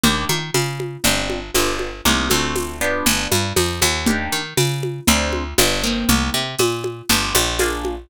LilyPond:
<<
  \new Staff \with { instrumentName = "Acoustic Guitar (steel)" } { \time 4/4 \key c \minor \tempo 4 = 119 <bes d' ees' g'>2 <c' d' f' g'>4 <b d' f' g'>4 | <bes c' ees' g'>8 <a c' d' fis'>4 <b d' f' g'>2~ <b d' f' g'>8 | <bes d' ees' g'>2 <c' d' f' aes'>4 <b d' f' g'>8 <bes c' ees' g'>8~ | <bes c' ees' g'>2 <b d' f' g'>4 <bes d' f' aes'>4 | }
  \new Staff \with { instrumentName = "Electric Bass (finger)" } { \clef bass \time 4/4 \key c \minor ees,8 ees8 des4 g,,4 g,,4 | c,8 d,4. g,,8 g,8 f,8 ees,8~ | ees,8 ees8 des4 d,4 g,,4 | c,8 c8 bes,4 g,,8 bes,,4. | }
  \new DrumStaff \with { instrumentName = "Drums" } \drummode { \time 4/4 cgl8 cgho8 <cgho tamb>8 cgho8 cgl8 cgho8 <cgho tamb>8 cgho8 | cgl8 cgho8 <cgho tamb>4 cgl8 cgho8 <cgho tamb>8 cgho8 | cgl4 <cgho tamb>8 cgho8 cgl8 cgho8 <cgho tamb>4 | cgl4 <cgho tamb>8 cgho8 cgl8 cgho8 <cgho tamb>8 cgho8 | }
>>